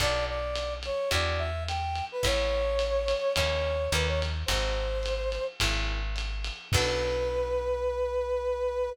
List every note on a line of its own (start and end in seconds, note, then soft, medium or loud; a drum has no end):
0.00 0.90 B1 loud
0.00 0.39 B3 medium
0.00 0.39 D4 medium
0.00 0.39 F#4 medium
0.00 0.39 A4 medium
0.00 0.25 D5 loud
0.00 kick medium
0.00 ride medium
0.28 0.74 D5 medium
0.55 hi-hat pedal medium
0.55 ride medium
0.83 1.09 C#5 medium
0.83 ride medium
1.11 2.02 E2 loud
1.11 1.50 D4 medium
1.11 1.50 E4 medium
1.11 1.50 F#4 medium
1.11 1.50 G4 medium
1.11 1.40 D5 medium
1.11 kick medium
1.11 ride loud
1.39 1.64 E5 medium
1.68 2.05 G5 medium
1.68 hi-hat pedal medium
1.68 ride medium
1.95 ride medium
2.12 2.25 B4 medium
2.23 3.14 A1 loud
2.23 2.62 B3 medium
2.23 2.62 C#4 medium
2.23 2.62 E4 medium
2.23 2.62 A4 medium
2.23 3.34 C#5 loud
2.23 kick medium
2.23 ride loud
2.79 hi-hat pedal medium
2.79 ride medium
3.08 ride medium
3.36 3.88 D#2 medium
3.36 3.77 A#3 medium
3.36 3.77 C#4 medium
3.36 3.77 D#4 medium
3.36 3.77 G#4 medium
3.36 3.90 C#5 medium
3.36 kick medium
3.36 ride loud
3.92 4.44 D#2 loud
3.92 4.32 A#3 medium
3.92 4.32 C#4 medium
3.92 4.32 D#4 medium
3.92 4.32 G4 medium
3.92 4.07 B4 medium
3.92 hi-hat pedal medium
3.92 ride medium
4.07 4.21 C#5 medium
4.22 ride medium
4.46 5.38 G#1 loud
4.46 4.87 C4 medium
4.46 4.87 D#4 medium
4.46 4.87 F#4 medium
4.46 4.87 G#4 medium
4.46 5.45 C5 medium
4.46 kick medium
4.46 ride loud
5.03 hi-hat pedal medium
5.03 ride medium
5.32 ride medium
5.60 6.51 G#1 loud
5.60 6.00 A#3 medium
5.60 6.00 C#4 medium
5.60 6.00 E4 medium
5.60 6.00 G#4 medium
5.60 kick medium
5.60 ride loud
6.16 hi-hat pedal medium
6.16 ride medium
6.44 ride medium
6.72 8.89 B1 loud
6.72 8.91 B3 loud
6.72 8.91 D4 loud
6.72 8.91 F#4 medium
6.72 8.91 A4 loud
6.72 8.90 B4 loud
6.72 kick loud
6.72 crash loud